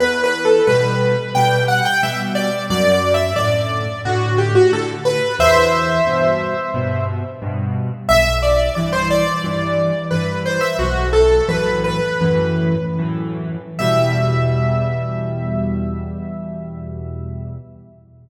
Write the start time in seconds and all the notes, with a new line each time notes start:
0.00 E2 B4
0.24 B4
0.45 A4
0.67 B2 G3 B4
1.35 B2 G3 G5
1.68 F#5
1.85 G5
2.03 B2 G3 E5
2.35 D5
2.70 F#2 D5
2.92 D5
3.14 E5
3.36 A2 D3 D5
4.05 A2 D3 F#4
4.38 G4
4.55 F#4
4.72 A2 D3 A4
5.05 B4
5.39 E2 C5 E5
6.07 G2 B2
6.74 G2 B2
7.42 G2 B2
8.09 B1 E5
8.42 D5
8.75 G2 E3 D5
8.93 C5
9.11 D5
9.44 G2 E3
10.11 G2 E3 B4
10.46 C5
10.61 E5
10.79 B1 F#4
11.13 A4
11.48 F#2 A2 E3 B4
11.84 B4
12.21 F#2 A2 E3
12.98 F#2 A2 E3
13.79 E2 B2 G3 E5